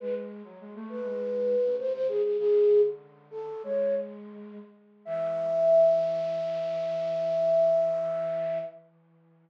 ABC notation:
X:1
M:4/4
L:1/16
Q:1/4=101
K:Emix
V:1 name="Flute"
B z5 B6 ^B B G G | "^rit." G3 z3 A2 c2 z6 | e16 |]
V:2 name="Flute"
G,3 F, G, A,2 G,4 C, ^B,,2 C,2 | "^rit." C,2 D,6 G,6 z2 | E,16 |]